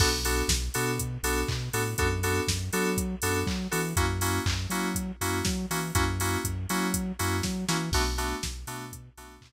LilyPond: <<
  \new Staff \with { instrumentName = "Electric Piano 2" } { \time 4/4 \key b \dorian \tempo 4 = 121 <b d' fis' a'>8 <b d' fis' a'>4 <b d' fis' a'>4 <b d' fis' a'>4 <b d' fis' a'>8 | <b d' fis' a'>8 <b d' fis' a'>4 <b d' fis' a'>4 <b d' fis' a'>4 <b d' fis' a'>8 | <ais cis' e' fis'>8 <ais cis' e' fis'>4 <ais cis' e' fis'>4 <ais cis' e' fis'>4 <ais cis' e' fis'>8 | <ais cis' e' fis'>8 <ais cis' e' fis'>4 <ais cis' e' fis'>4 <ais cis' e' fis'>4 <ais cis' e' fis'>8 |
<a b d' fis'>8 <a b d' fis'>4 <a b d' fis'>4 <a b d' fis'>4 r8 | }
  \new Staff \with { instrumentName = "Synth Bass 2" } { \clef bass \time 4/4 \key b \dorian b,,4 b,,8 b,4 b,,8 b,8 a,8 | fis,4 fis,8 fis4 fis,8 fis8 e8 | fis,4 fis,8 fis4 fis,8 fis8 e8 | fis,4 fis,8 fis4 fis,8 fis8 e8 |
b,,4 b,,8 b,4 b,,8 b,8 r8 | }
  \new DrumStaff \with { instrumentName = "Drums" } \drummode { \time 4/4 <cymc bd>8 hho8 <bd sn>8 hho8 <hh bd>8 hho8 <hc bd>8 hho8 | <hh bd>8 hho8 <bd sn>8 hho8 <hh bd>8 hho8 <hc bd>8 hho8 | <hh bd>8 hho8 <hc bd>8 hho8 <hh bd>8 hho8 <bd sn>8 hho8 | <hh bd>8 hho8 <hh bd>8 hho8 <hh bd>8 hho8 <bd sn>8 sn8 |
<cymc bd>8 hho8 <bd sn>8 hho8 <hh bd>8 hho8 <hc bd>4 | }
>>